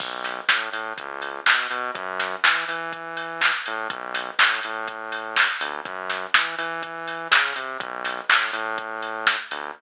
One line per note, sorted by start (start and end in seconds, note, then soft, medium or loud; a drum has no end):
0.00 0.41 B1 medium
0.00 kick loud
0.00 crash loud
0.24 snare medium
0.24 open hi-hat medium
0.49 0.69 A2 medium
0.49 kick medium
0.49 snare loud
0.72 0.93 A2 medium
0.72 open hi-hat medium
0.98 1.40 C#2 medium
0.98 kick medium
0.98 closed hi-hat loud
1.22 open hi-hat medium
1.46 1.67 B2 medium
1.46 kick medium
1.46 clap loud
1.71 1.91 B2 medium
1.71 open hi-hat medium
1.95 2.36 F#2 medium
1.95 kick loud
1.95 closed hi-hat loud
2.20 snare medium
2.20 open hi-hat medium
2.44 2.65 E3 medium
2.44 kick medium
2.44 clap loud
2.68 3.51 E3 medium
2.68 open hi-hat medium
2.93 kick medium
2.93 closed hi-hat loud
3.17 open hi-hat medium
3.41 kick medium
3.41 clap loud
3.66 3.88 A2 medium
3.66 open hi-hat medium
3.89 4.31 B1 medium
3.89 kick loud
3.89 closed hi-hat loud
4.14 snare medium
4.14 open hi-hat medium
4.39 4.60 A2 medium
4.39 kick medium
4.39 clap loud
4.63 5.48 A2 medium
4.63 open hi-hat medium
4.88 kick medium
4.88 closed hi-hat loud
5.12 open hi-hat medium
5.36 kick medium
5.36 clap loud
5.60 5.81 D2 medium
5.60 open hi-hat loud
5.85 6.26 F#2 medium
5.85 kick loud
5.85 closed hi-hat loud
6.10 snare medium
6.10 open hi-hat medium
6.34 6.55 E3 medium
6.34 kick loud
6.34 snare loud
6.58 7.28 E3 medium
6.58 open hi-hat medium
6.83 kick medium
6.83 closed hi-hat loud
7.08 open hi-hat medium
7.31 7.53 C#3 medium
7.31 kick medium
7.31 clap loud
7.56 7.78 C3 medium
7.56 open hi-hat medium
7.80 8.21 B1 medium
7.80 kick loud
7.80 closed hi-hat loud
8.05 snare medium
8.05 open hi-hat medium
8.29 8.51 A2 medium
8.29 kick medium
8.29 clap loud
8.53 9.36 A2 medium
8.53 open hi-hat medium
8.78 kick medium
8.78 closed hi-hat loud
9.02 open hi-hat medium
9.27 kick medium
9.27 snare medium
9.51 9.72 D2 medium
9.51 open hi-hat medium